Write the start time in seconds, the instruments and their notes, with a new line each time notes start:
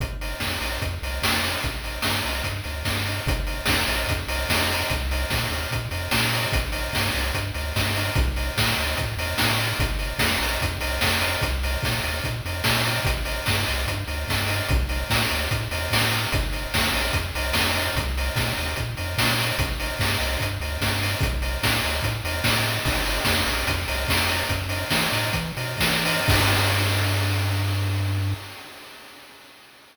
0.00 synth bass 1 G1, kick, closed hi-hat
0.21 open hi-hat
0.40 synth bass 1 F2, kick, snare
0.61 synth bass 1 A#1, open hi-hat
0.82 synth bass 1 F2, kick, closed hi-hat
1.02 synth bass 1 C2, open hi-hat
1.22 synth bass 1 F2, kick, snare
1.44 open hi-hat
1.63 synth bass 1 A1, kick, closed hi-hat
1.84 open hi-hat
2.02 synth bass 1 G2, kick, snare
2.25 synth bass 1 C2, open hi-hat
2.44 synth bass 1 G2, kick, closed hi-hat
2.64 synth bass 1 D2, open hi-hat
2.85 synth bass 1 G2, kick, snare
3.06 open hi-hat
3.26 synth bass 1 G1, kick, closed hi-hat
3.47 open hi-hat
3.66 synth bass 1 F2, kick, snare
3.87 synth bass 1 A#1, open hi-hat
4.08 synth bass 1 F2, kick, closed hi-hat
4.28 synth bass 1 C2, open hi-hat
4.49 synth bass 1 F2, kick, snare
4.71 open hi-hat
4.90 synth bass 1 C2, kick, closed hi-hat
5.11 open hi-hat
5.30 synth bass 1 A#2, kick, snare
5.50 synth bass 1 D#2, open hi-hat
5.71 synth bass 1 A#2, kick, closed hi-hat
5.91 synth bass 1 F2, open hi-hat
6.11 synth bass 1 A#2, kick, snare
6.34 open hi-hat
6.52 synth bass 1 A1, kick, closed hi-hat
6.72 open hi-hat
6.93 synth bass 1 G2, kick, snare
7.15 synth bass 1 C2, open hi-hat
7.34 synth bass 1 G2, kick, closed hi-hat
7.54 synth bass 1 D2, open hi-hat
7.76 synth bass 1 G2, kick, snare
7.95 open hi-hat
8.15 synth bass 1 B1, kick, closed hi-hat
8.36 open hi-hat
8.57 synth bass 1 A2, kick, snare
8.78 synth bass 1 D2, open hi-hat
8.97 synth bass 1 A2, kick, closed hi-hat
9.17 synth bass 1 E2, open hi-hat
9.38 synth bass 1 A2, kick, snare
9.60 open hi-hat
9.79 synth bass 1 G1, kick, closed hi-hat
9.99 open hi-hat
10.19 synth bass 1 F2, kick, snare
10.41 synth bass 1 A#1, open hi-hat
10.61 synth bass 1 F2, kick, closed hi-hat
10.81 synth bass 1 C2, open hi-hat
11.01 synth bass 1 F2, kick, snare
11.21 open hi-hat
11.42 synth bass 1 C2, kick, closed hi-hat
11.63 open hi-hat
11.83 synth bass 1 A#2, kick, snare
12.03 synth bass 1 D#2, open hi-hat
12.24 synth bass 1 A#2, kick, closed hi-hat
12.45 synth bass 1 F2, open hi-hat
12.64 synth bass 1 A#2, kick, snare
12.85 open hi-hat
13.05 synth bass 1 A1, kick, closed hi-hat
13.25 open hi-hat
13.46 synth bass 1 G2, kick, snare
13.67 synth bass 1 C2, open hi-hat
13.87 synth bass 1 G2, kick, closed hi-hat
14.07 synth bass 1 D2, open hi-hat
14.28 synth bass 1 G2, kick, snare
14.48 open hi-hat
14.69 synth bass 1 B1, kick, closed hi-hat
14.89 open hi-hat
15.10 synth bass 1 A2, kick, snare
15.30 synth bass 1 D2, open hi-hat
15.51 synth bass 1 A2, kick, closed hi-hat
15.71 synth bass 1 E2, open hi-hat
15.91 synth bass 1 A2, kick, snare
16.11 open hi-hat
16.32 synth bass 1 G1, kick, closed hi-hat
16.53 open hi-hat
16.74 synth bass 1 F2, kick, snare
16.94 synth bass 1 A#1, open hi-hat
17.13 synth bass 1 F2, kick, closed hi-hat
17.35 synth bass 1 C2, open hi-hat
17.53 synth bass 1 F2, kick, snare
17.76 open hi-hat
17.96 synth bass 1 C2, kick, closed hi-hat
18.18 open hi-hat
18.36 synth bass 1 A#2, kick, snare
18.57 synth bass 1 D#2, open hi-hat
18.76 synth bass 1 A#2, kick, closed hi-hat
18.97 synth bass 1 F2, open hi-hat
19.18 synth bass 1 A#2, kick, snare
19.40 open hi-hat
19.58 synth bass 1 A1, kick, closed hi-hat
19.80 open hi-hat
19.99 synth bass 1 G2, kick, snare
20.20 synth bass 1 C2, open hi-hat
20.40 synth bass 1 G2, kick, closed hi-hat
20.60 synth bass 1 D2, open hi-hat
20.81 synth bass 1 G2, kick, snare
21.02 open hi-hat
21.21 synth bass 1 B1, kick, closed hi-hat
21.42 open hi-hat
21.63 synth bass 1 A2, kick, snare
21.84 synth bass 1 D2, open hi-hat
22.02 synth bass 1 A2, kick, closed hi-hat
22.24 synth bass 1 E2, open hi-hat
22.44 synth bass 1 A2, kick, snare
22.66 open hi-hat
22.85 synth bass 1 G1, kick, crash
23.06 open hi-hat
23.25 synth bass 1 F2, kick, snare
23.46 synth bass 1 A#1, open hi-hat
23.67 synth bass 1 F2, kick, closed hi-hat
23.88 synth bass 1 C2, open hi-hat
24.08 synth bass 1 F2, kick, snare
24.28 open hi-hat
24.49 synth bass 1 F#2, kick, closed hi-hat
24.69 open hi-hat
24.90 synth bass 1 E3, kick, snare
25.12 synth bass 1 A2, open hi-hat
25.33 synth bass 1 E3, kick, closed hi-hat
25.57 synth bass 1 B2, open hi-hat
25.78 synth bass 1 E3, kick, snare
26.05 open hi-hat
26.28 synth bass 1 G2, kick, crash